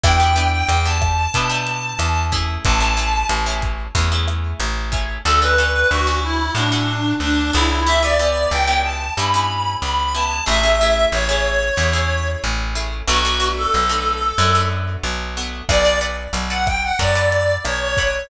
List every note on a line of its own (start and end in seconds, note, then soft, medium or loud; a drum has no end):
0.04 0.63 E2 medium
0.04 0.17 B3 loud
0.04 0.17 D4 medium
0.04 0.17 E4 loud
0.04 0.17 G4 medium
0.04 0.47 G5 medium
0.04 kick medium
0.04 cross-stick loud
0.04 closed hi-hat loud
0.20 0.33 B3 medium
0.20 0.33 D4 medium
0.20 0.33 E4 medium
0.20 0.33 G4 medium
0.36 0.75 B3 medium
0.36 0.75 D4 medium
0.36 0.75 E4 medium
0.36 0.75 G4 medium
0.36 closed hi-hat medium
0.53 0.68 G5 medium
0.68 1.27 E2 medium
0.68 0.85 G5 medium
0.68 closed hi-hat loud
0.85 1.24 B3 medium
0.85 1.24 D4 medium
0.85 1.24 E4 medium
0.85 1.24 G4 medium
0.85 2.22 A5 medium
1.01 kick medium
1.01 cross-stick medium
1.01 closed hi-hat medium
1.34 1.93 B2 medium
1.34 1.48 B3 loud
1.34 1.48 D4 medium
1.34 1.48 E4 medium
1.34 1.48 G4 medium
1.34 kick medium
1.34 closed hi-hat loud
1.49 2.02 B3 medium
1.49 2.02 D4 medium
1.49 2.02 E4 medium
1.49 2.02 G4 medium
1.67 closed hi-hat medium
1.99 2.57 E2 medium
1.99 cross-stick medium
1.99 closed hi-hat loud
2.32 2.78 A3 medium
2.32 2.78 C#4 loud
2.32 2.78 E4 loud
2.32 2.78 G#4 loud
2.32 kick medium
2.32 closed hi-hat medium
2.65 3.24 A1 loud
2.65 3.27 A5 medium
2.65 kick medium
2.65 closed hi-hat loud
2.80 2.93 A3 medium
2.80 2.93 C#4 medium
2.80 2.93 E4 medium
2.80 2.93 G#4 medium
2.97 3.36 A3 medium
2.97 3.36 C#4 medium
2.97 3.36 E4 medium
2.97 3.36 G#4 medium
2.97 closed hi-hat medium
3.29 3.88 A1 medium
3.29 cross-stick medium
3.29 closed hi-hat loud
3.46 3.85 A3 medium
3.46 3.85 C#4 medium
3.46 3.85 E4 loud
3.46 3.85 G#4 medium
3.62 kick medium
3.62 closed hi-hat medium
3.95 4.54 E2 medium
3.95 4.08 A3 medium
3.95 4.08 C#4 medium
3.95 4.08 E4 medium
3.95 4.08 G#4 medium
3.95 kick medium
3.95 closed hi-hat loud
4.12 4.64 A3 medium
4.12 4.64 C#4 medium
4.12 4.64 E4 medium
4.12 4.64 G#4 medium
4.28 cross-stick medium
4.28 closed hi-hat medium
4.60 5.18 A1 medium
4.60 closed hi-hat loud
4.92 5.18 A3 medium
4.92 5.18 C#4 medium
4.92 5.18 E4 medium
4.92 5.18 G#4 medium
4.92 kick medium
4.92 closed hi-hat medium
5.25 5.84 D2 medium
5.25 5.39 C#4 medium
5.25 5.39 D4 loud
5.25 5.39 F#4 loud
5.25 5.39 A4 loud
5.25 5.41 A4 medium
5.42 5.55 C#4 medium
5.42 5.55 D4 medium
5.42 5.55 F#4 medium
5.42 5.55 A4 medium
5.42 5.89 B4 medium
5.58 5.97 C#4 medium
5.58 5.97 D4 medium
5.58 5.97 F#4 medium
5.58 5.97 A4 medium
5.91 6.50 D2 medium
5.91 6.20 F#4 medium
6.07 6.46 C#4 medium
6.07 6.46 D4 medium
6.07 6.46 F#4 medium
6.07 6.46 A4 medium
6.24 6.52 E4 medium
6.55 7.13 A2 medium
6.55 6.69 C#4 medium
6.55 6.69 D4 medium
6.55 7.14 D4 medium
6.55 6.69 F#4 medium
6.55 6.69 A4 medium
6.72 7.24 C#4 medium
6.72 7.24 D4 medium
6.72 7.24 F#4 medium
6.72 7.24 A4 medium
7.20 7.51 D2 medium
7.20 7.51 D4 medium
7.53 8.46 C#2 loud
7.53 7.79 C#4 medium
7.53 7.79 D4 medium
7.53 7.82 E4 medium
7.53 7.79 F#4 medium
7.53 7.79 A4 medium
7.86 7.99 B3 loud
7.86 7.99 C#4 medium
7.86 7.99 E4 medium
7.86 7.99 G4 medium
7.86 8.02 E5 medium
8.03 8.16 B3 medium
8.03 8.16 C#4 medium
8.03 8.16 E4 medium
8.03 8.16 G4 medium
8.03 8.50 D5 medium
8.19 8.59 B3 medium
8.19 8.59 C#4 medium
8.19 8.59 E4 medium
8.19 8.59 G4 medium
8.51 9.10 C#2 medium
8.51 8.82 G5 medium
8.67 9.07 B3 medium
8.67 9.07 C#4 medium
8.67 9.07 E4 medium
8.67 9.07 G4 medium
8.84 9.13 A5 medium
9.17 9.76 G2 medium
9.17 9.31 B3 medium
9.17 9.31 C#4 medium
9.17 9.31 E4 medium
9.17 9.31 G4 medium
9.17 9.72 B5 medium
9.34 9.86 B3 medium
9.34 9.86 C#4 medium
9.34 9.86 E4 medium
9.34 9.86 G4 medium
9.82 10.41 C#2 medium
9.82 10.13 B5 medium
10.15 10.41 B3 medium
10.15 10.41 C#4 medium
10.15 10.41 E4 medium
10.15 10.41 G4 medium
10.15 10.45 A5 medium
10.46 11.06 A1 medium
10.46 10.59 A3 loud
10.46 10.59 C#4 medium
10.46 10.59 E4 loud
10.46 10.59 G#4 loud
10.46 11.05 E5 medium
10.63 10.76 A3 medium
10.63 10.76 C#4 medium
10.63 10.76 E4 medium
10.63 10.76 G#4 medium
10.81 11.20 A3 medium
10.81 11.20 C#4 medium
10.81 11.20 E4 medium
10.81 11.20 G#4 medium
11.12 11.71 A1 medium
11.12 12.28 C#5 medium
11.29 11.68 A3 medium
11.29 11.68 C#4 medium
11.29 11.68 E4 medium
11.29 11.68 G#4 medium
11.77 12.36 E2 medium
11.77 11.91 A3 medium
11.77 11.91 C#4 medium
11.77 11.91 E4 medium
11.77 11.91 G#4 medium
11.93 12.46 A3 medium
11.93 12.46 C#4 medium
11.93 12.46 E4 medium
11.93 12.46 G#4 medium
12.44 13.02 A1 medium
12.75 13.01 A3 medium
12.75 13.01 C#4 medium
12.75 13.01 E4 medium
12.75 13.01 G#4 medium
13.07 13.67 B1 loud
13.07 13.21 A3 loud
13.07 13.21 B3 loud
13.07 13.21 D4 loud
13.07 13.21 F#4 loud
13.07 13.48 F#4 medium
13.25 13.38 A3 medium
13.25 13.38 B3 medium
13.25 13.38 D4 medium
13.25 13.38 F#4 medium
13.40 13.79 A3 medium
13.40 13.79 B3 medium
13.40 13.79 D4 medium
13.40 13.79 F#4 medium
13.57 14.57 A4 medium
13.74 14.33 B1 medium
13.89 14.28 A3 medium
13.89 14.28 B3 medium
13.89 14.28 D4 medium
13.89 14.28 F#4 medium
14.38 14.97 F#2 loud
14.38 14.51 A3 medium
14.38 14.51 B3 medium
14.38 14.51 D4 medium
14.38 14.51 F#4 medium
14.55 15.07 A3 medium
14.55 15.07 B3 medium
14.55 15.07 D4 medium
14.55 15.07 F#4 medium
15.03 15.62 B1 medium
15.37 15.63 A3 medium
15.37 15.63 B3 medium
15.37 15.63 D4 medium
15.37 15.63 F#4 medium
15.69 16.28 B1 medium
15.69 15.82 A4 medium
15.69 15.82 B4 loud
15.69 15.82 D5 loud
15.69 15.99 D5 medium
15.69 15.82 F#5 loud
15.69 kick medium
15.69 cross-stick loud
15.69 crash medium
15.85 15.98 A4 medium
15.85 15.98 B4 medium
15.85 15.98 D5 medium
15.85 15.98 F#5 medium
16.01 16.40 A4 medium
16.01 16.40 B4 medium
16.01 16.40 D5 medium
16.01 16.40 F#5 medium
16.01 closed hi-hat medium
16.33 16.92 B1 medium
16.33 closed hi-hat loud
16.50 16.89 A4 medium
16.50 16.89 B4 medium
16.50 16.89 D5 medium
16.50 16.89 F#5 medium
16.50 16.66 F#5 medium
16.67 16.82 G5 medium
16.67 kick medium
16.67 cross-stick medium
16.67 closed hi-hat medium
16.83 16.99 F#5 medium
16.99 17.58 F#2 medium
16.99 17.12 A4 medium
16.99 17.12 B4 medium
16.99 17.12 D5 medium
16.99 17.54 D5 medium
16.99 17.12 F#5 medium
16.99 kick medium
16.99 closed hi-hat medium
17.15 17.68 A4 medium
17.15 17.68 B4 medium
17.15 17.68 D5 medium
17.15 17.68 F#5 medium
17.32 closed hi-hat medium
17.65 18.24 B1 medium
17.65 17.80 C#5 medium
17.65 cross-stick medium
17.65 closed hi-hat loud
17.81 18.23 C#5 medium
17.97 18.24 A4 medium
17.97 18.24 B4 medium
17.97 18.24 D5 medium
17.97 18.24 F#5 loud
17.97 kick medium
17.97 closed hi-hat medium